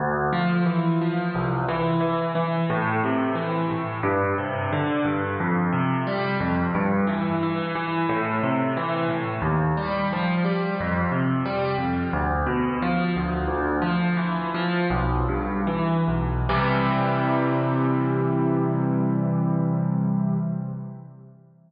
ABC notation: X:1
M:4/4
L:1/8
Q:1/4=89
K:C
V:1 name="Acoustic Grand Piano" clef=bass
D,, F, E, F, C,, E, E, E, | A,, C, E, A,, G,, C, D, G,, | F,, C, G, F,, G,, E, E, E, | A,, C, E, A,, _E,, G, F, G, |
F,, C, G, F,, D,, B,, F, D,, | "^rit." D,, F, E, F, B,,, G,, E, B,,, | [C,E,G,]8 |]